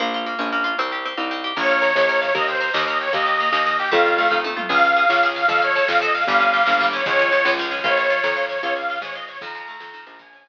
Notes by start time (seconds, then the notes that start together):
0.00 A#1 A#3
0.14 F4
0.26 A#3
0.39 A#1 C#4
0.52 A#3
0.64 F4
0.78 C2 C4
0.92 G4
1.05 C4
1.17 C2 D#4
1.31 C4
1.44 G4
1.57 A#1 A#4 C#5, kick, snare, crash
1.63 snare
1.69 F5, snare
1.76 snare
1.82 A#4, snare
1.90 snare
1.95 A#1 C#5, snare
2.03 snare
2.09 A#4, snare
2.16 snare
2.21 C#5 F5, snare
2.29 snare
2.35 D#2 A#4 D#5, kick, snare
2.42 snare
2.48 C5 G5, snare
2.55 snare
2.61 A#4, snare
2.68 snare
2.74 D#2 D#5, snare
2.81 snare
2.87 A#4 D#5, snare
2.94 snare
3.01 C#5 G5, snare
3.07 snare
3.13 D#2 A#3 D#5, kick, snare
3.20 snare
3.26 G4, snare
3.33 snare
3.40 A#3, snare
3.47 snare
3.52 D#2 D#4, snare
3.60 snare
3.66 A#3, snare
3.73 snare
3.79 G4 G5, snare
3.86 snare
3.92 F2 A3 F5, kick, snare
3.99 snare
4.05 F4, snare
4.12 snare
4.18 A3, snare
4.25 snare
4.30 F2 D#4, kick, snare
4.44 A3, high tom
4.57 F4, mid tom
4.69 C#2 G#4 F5, kick, snare, crash
4.77 snare
4.84 F5, snare
4.90 snare
4.96 G#4, snare
5.03 snare
5.09 C#2 C#5, snare
5.16 snare
5.23 G#4, snare
5.29 snare
5.36 F5, snare
5.42 snare
5.48 F2 A4 F5, kick, snare
5.56 snare
5.62 C#5 F5, snare
5.69 snare
5.75 A4, snare
5.82 snare
5.88 F2 C5 F5, snare
5.95 snare
6.01 A4 D#5, snare
6.08 snare
6.14 F5, snare
6.21 snare
6.27 G1 G3 F5, kick, snare
6.34 snare
6.39 C#4, snare
6.47 snare
6.54 G3, snare
6.60 snare
6.66 G1 A#3, snare
6.73 snare
6.80 G3, snare
6.86 snare
6.93 C#4 C#5, snare
6.99 snare
7.06 C#2 F3 C#5, kick, snare
7.12 snare
7.19 C#4, snare
7.26 snare
7.32 F3, snare
7.39 snare
7.45 C#2 G#3, snare
7.52 snare
7.58 F3, snare
7.65 snare
7.71 C#4, snare
7.78 snare
7.84 A#1 F4 C#5, kick, snare
7.91 snare
7.97 C#5, snare
8.04 snare
8.10 F4, snare
8.17 snare
8.24 F2 A#4, snare
8.30 snare
8.36 F4, snare
8.43 snare
8.49 C#5, snare
8.56 snare
8.62 C#2 F4 C#5, kick, snare
8.69 snare
8.76 C#5 F5, snare
8.82 snare
8.89 F4, snare
8.95 snare
9.01 G#2 G#4 C#5, snare
9.09 snare
9.15 F4 D#5, snare
9.22 snare
9.28 C#5, snare
9.35 snare
9.41 F2 D#3 A#5, kick, snare
9.48 snare
9.54 F3, snare
9.61 snare
9.67 A3, snare
9.74 snare
9.80 F2 C4, snare
9.87 snare
9.93 D#3, snare
10.00 snare
10.06 A#1 F3 A#5, snare
10.13 snare
10.19 F3 G#5, kick, snare
10.26 snare
10.33 C#4, snare
10.39 snare
10.46 F3, snare